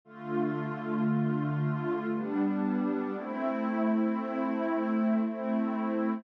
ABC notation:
X:1
M:3/4
L:1/8
Q:1/4=58
K:Gmix
V:1 name="Pad 2 (warm)"
[D,A,F]4 [G,B,D]2 | [A,CE]4 [A,CE]2 |]